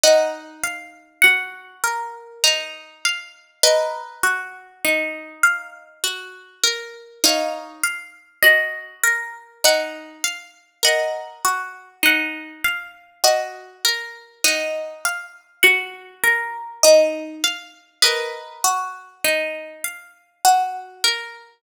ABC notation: X:1
M:3/4
L:1/16
Q:1/4=50
K:D#phr
V:1 name="Orchestral Harp"
[df]4 f4 a3 z | [Bd]4 z8 | [c^e]4 d2 z2 f4 | [df]4 f2 z2 d4 |
[df]4 f2 z2 d4 | [Bd]4 z8 |]
V:2 name="Orchestral Harp"
D2 ^e2 F2 A2 D2 e2 | A2 F2 D2 ^e2 F2 A2 | D2 ^e2 F2 A2 D2 e2 | A2 F2 D2 ^e2 F2 A2 |
D2 ^e2 F2 A2 D2 e2 | A2 F2 D2 ^e2 F2 A2 |]